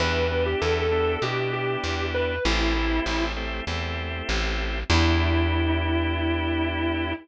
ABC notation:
X:1
M:4/4
L:1/16
Q:1/4=98
K:Em
V:1 name="Distortion Guitar"
B3 G (3A2 A2 A2 G2 G4 B2 | E6 z10 | E16 |]
V:2 name="Drawbar Organ"
[B,DEG]2 [B,DEG]4 [B,DEG]2 [B,DEG]8 | [A,CEG]2 [A,CEG]4 [A,CEG]2 [A,CEG]8 | [B,DEG]16 |]
V:3 name="Electric Bass (finger)" clef=bass
E,,4 E,,4 B,,4 E,,4 | A,,,4 A,,,4 E,,4 A,,,4 | E,,16 |]